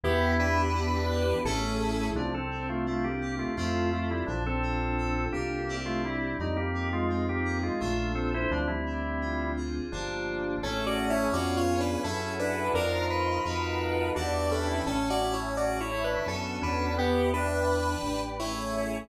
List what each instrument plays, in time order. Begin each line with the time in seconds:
0.03 synth bass 1 E2, electric piano 2 B3, lead 1 (square) B3 G4, pad 5 (bowed) B3 D4 E4 G4, drawbar organ E4
0.39 electric piano 2 D4, lead 1 (square) D4 B4
0.74 electric piano 2 E4
1.10 electric piano 2 G4
1.44 synth bass 1 A1, pad 5 (bowed) A3 C#4 E4 G#4, electric piano 2 A3 C#4 E4 G#4, lead 1 (square) C#4 A4
2.14 synth bass 1 C2, drawbar organ F3 D4, electric piano 2 C4
2.34 drawbar organ C4 A4
2.51 electric piano 2 D4
2.69 drawbar organ A3 F4
2.86 drawbar organ A3 F4, electric piano 2 E4
3.04 drawbar organ A#3 G4
3.21 electric piano 2 G4
3.39 drawbar organ A3 F4
3.57 synth bass 1 F2, drawbar organ A3 F4, electric piano 2 C4 E4 F4 A4
3.93 drawbar organ A3 F4
4.10 drawbar organ G3 E4
4.26 synth bass 1 A#1, drawbar organ F3 D4, electric piano 2 D4
4.46 drawbar organ C4 A4
4.63 electric piano 2 F4
4.98 electric piano 2 A4
5.32 synth bass 1 C2, drawbar organ A#3 G4, electric piano 2 A#4
5.69 electric piano 2 C4 D4 E4 G4
5.85 drawbar organ A3 F4
6.04 drawbar organ G3 E4
6.39 synth bass 1 F2, drawbar organ G3 D#4, electric piano 2 C4
6.56 drawbar organ A#3 G4
6.74 electric piano 2 D#4
6.92 drawbar organ G#3 F4
7.09 drawbar organ G#3 F4, electric piano 2 F4
7.29 drawbar organ A#3 G4
7.45 electric piano 2 G#4
7.63 drawbar organ G#3 F4
7.80 synth bass 1 A#1, drawbar organ A3 F4, electric piano 2 A#3 D4 F4 A4
8.15 drawbar organ C4 A4
8.34 drawbar organ E4 C5
8.51 synth bass 1 D2, drawbar organ F3 D4, electric piano 2 C4
8.67 drawbar organ G3 E4
8.86 electric piano 2 D4
9.21 electric piano 2 F4
9.57 electric piano 2 G#4
9.92 synth bass 1 G1, drawbar organ F3 D4, electric piano 2 A#3 D4 F4 G4
10.63 synth bass 1 A1, electric piano 2 A3 C#4 E4 G#4, lead 1 (square) C#4 A4, drawbar organ C#4, pad 5 (bowed) C#5 E5 G#5 A5
10.86 lead 1 (square) F#4 D5
11.10 lead 1 (square) E4 C#5
11.32 synth bass 1 F2, electric piano 2 B3 C#4 F4 G#4, lead 1 (square) F#4 D5, pad 5 (bowed) B4 C#5 F5 G#5
11.57 lead 1 (square) F4 C#5
11.80 lead 1 (square) D4 B4
12.03 synth bass 1 F#2, lead 1 (square) C#4 A4, drawbar organ E4, electric piano 2 E4 F#4 G#4 A4, pad 5 (bowed) E5 F#5 G#5 A5
12.39 lead 1 (square) D4 B4
12.73 synth bass 1 F2, lead 1 (square) D4 A#4, electric piano 2 D#4 F4 A#4 C5, drawbar organ A#4, pad 5 (bowed) D#5 F5 A#5 C6
13.10 lead 1 (square) B4
13.44 synth bass 1 F2, electric piano 2 D#4 F4 F#4 A4, pad 5 (bowed) D#5 F5 F#5 A5
14.15 synth bass 1 E2, drawbar organ D4, electric piano 2 D4 E4 G4 B4, lead 1 (square) F#4 D5, pad 5 (bowed) D5 E5 G5 B5
14.51 lead 1 (square) C#4 A4
14.68 drawbar organ E4
14.86 synth bass 1 A1, lead 1 (square) C#4 A4, electric piano 2 C#4, drawbar organ C#4, pad 5 (bowed) C#5 E5 G#5 A5
15.10 lead 1 (square) F#4 D5
15.21 drawbar organ C#4, electric piano 2 E4
15.33 lead 1 (square) E4 C#5
15.57 lead 1 (square) F#4 D5, electric piano 2 G#4, pad 5 (bowed) C#5 E5 A5 C#6
15.80 lead 1 (square) E4 C#5
15.91 drawbar organ E4, electric piano 2 A4
16.04 lead 1 (square) D4 B4
16.26 synth bass 1 F#2, electric piano 2 B3 D4 F#4 A4, lead 1 (square) C#4 A4, pad 5 (bowed) B4 D5 F#5 A5
16.61 synth bass 1 E2, drawbar organ C#4, lead 1 (square) D4 B4
16.97 drawbar organ B3, electric piano 2 B3, lead 1 (square) B3 G4, pad 5 (bowed) B4 D5 E5 G5
17.33 electric piano 2 D4, lead 1 (square) D4 B4, drawbar organ D4
17.68 electric piano 2 E4, pad 5 (bowed) B4 D5 G5 B5
18.03 synth bass 1 A1, electric piano 2 G4
18.39 electric piano 2 A3 C#4 E4 G#4, lead 1 (square) E4 C#5, pad 5 (bowed) A4 C#5 E5 G#5